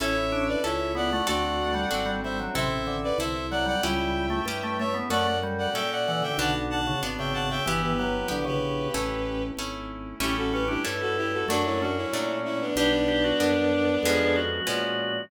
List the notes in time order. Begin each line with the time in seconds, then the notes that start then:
0.00 A1 C#4 E4 A4 C#5 E5
0.32 D4
0.48 B4 D5
0.64 C#2 C#4 E4 A4 C#5 E5
0.95 B3 D5 F#5
1.12 A3 D5 F#5
1.27 D2 A3 C4 D4 F#4 A4 D5 F#5
1.74 G3
1.91 G#1 C4 D4 F#4 A4
2.06 G3
2.23 G3 C5 E5
2.39 F#3
2.55 A1 C3 C4 E4 A4 C5 E5
2.87 D3
3.03 B4 D5
3.18 C2 C4 E4 A4 C5 E5
3.51 F#3 D5 F#5
3.66 G3 D5 F#5
3.83 C#2 G3 C#4 E4 G4 E5 G5
4.30 A3
4.45 G2 C#4 E4 G4
4.63 A3
4.79 A3 C#5 E5
4.94 B3
5.10 F#2 A3 C#4 F#4 A4 D5 F#5
5.43 G3
5.58 D5 F#5
5.74 A#2 C#4 F#4 A4 E5 G5
5.91 D5 F#5
6.07 E3 D5 F#5
6.22 D3 E5 G5
6.37 B1 D3 B3 D4 F#4 F#5 A5
6.70 F#5 A5
6.87 C#3
7.03 G#1 B3 D4 F#4
7.18 C#3 E5 G5
7.34 C#3 F#5 A5
7.49 C#3 E5 G5
7.66 G1 E3 B3 E4 G4
7.82 G4 B4
7.98 F#3 G4 B4
8.28 A#1 D3 B3 E4 G4
8.45 C#3 G4 B4
8.93 A1 A3 C#4 E4
9.57 G#1 A3 C#4 E4
10.20 A1 G3 A3 C#4 E4 G4
10.37 F#4 A4
10.53 C#4 G4 B4
10.68 D4 E4 G4
10.84 G2 G3 A3 C#4 E4
11.01 F#4 A4
11.17 E4 G4
11.33 F#4 A4
11.48 F#2 F#3 A3 D4 F#4
11.65 C#4 E4
11.81 C#4 D4 F#4
11.97 C#4 E4
12.13 A#2 F#3 A3 D4
12.45 C#4 E4
12.61 B3 D4
12.76 B1 G3 B3 D4 G4
13.08 G4
13.24 F#4
13.40 F#2 G3 B3 D4
14.03 F2 F3 G#3 B3 C#4 G#4
14.36 F#4
14.67 A#2 F3 G#3 B3 C#4